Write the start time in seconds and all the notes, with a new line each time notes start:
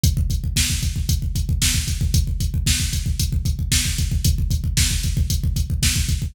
0.03 kick, closed hi-hat
0.17 kick
0.30 kick, closed hi-hat
0.44 kick
0.56 kick, snare
0.70 kick
0.83 kick, closed hi-hat
0.96 kick
1.09 kick, closed hi-hat
1.22 kick
1.35 kick, closed hi-hat
1.49 kick
1.62 kick, snare
1.74 kick
1.88 kick, closed hi-hat
2.01 kick
2.14 kick, closed hi-hat
2.27 kick
2.40 kick, closed hi-hat
2.54 kick
2.66 kick, snare
2.80 kick
2.93 kick, closed hi-hat
3.06 kick
3.19 kick, closed hi-hat
3.32 kick
3.45 kick, closed hi-hat
3.59 kick
3.72 kick, snare
3.85 kick
3.98 kick, closed hi-hat
4.12 kick
4.24 kick, closed hi-hat
4.38 kick
4.50 kick, closed hi-hat
4.64 kick
4.77 kick, snare
4.91 kick
5.03 kick, closed hi-hat
5.17 kick
5.30 kick, closed hi-hat
5.44 kick
5.56 kick, closed hi-hat
5.70 kick
5.83 kick, snare
5.96 kick
6.09 kick, closed hi-hat
6.22 kick